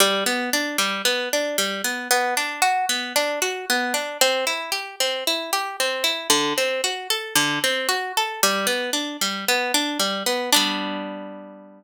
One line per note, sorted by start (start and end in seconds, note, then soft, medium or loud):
0.00 0.24 G3 loud
0.26 0.50 B3 medium
0.53 0.77 D4 medium
0.78 1.02 G3 medium
1.05 1.29 B3 medium
1.33 1.57 D4 medium
1.58 1.82 G3 medium
1.84 2.08 B3 medium
2.11 2.34 B3 loud
2.37 2.61 D4 medium
2.62 2.86 F#4 medium
2.89 3.13 B3 medium
3.16 3.39 D4 medium
3.42 3.66 F#4 medium
3.70 3.93 B3 medium
3.94 4.18 D4 medium
4.21 4.45 C4 loud
4.47 4.71 E4 medium
4.72 4.96 G4 medium
5.00 5.24 C4 medium
5.27 5.51 E4 medium
5.53 5.77 G4 medium
5.80 6.04 C4 medium
6.04 6.28 E4 medium
6.30 6.54 D3 loud
6.58 6.81 C4 medium
6.84 7.08 F#4 medium
7.10 7.34 A4 medium
7.35 7.59 D3 medium
7.64 7.87 C4 medium
7.89 8.12 F#4 medium
8.17 8.41 A4 medium
8.43 8.67 G3 loud
8.67 8.90 B3 medium
8.93 9.17 D4 medium
9.21 9.45 G3 medium
9.48 9.72 B3 medium
9.74 9.98 D4 medium
9.99 10.23 G3 medium
10.26 10.50 B3 medium
10.53 11.84 G3 loud
10.53 11.84 B3 loud
10.53 11.84 D4 loud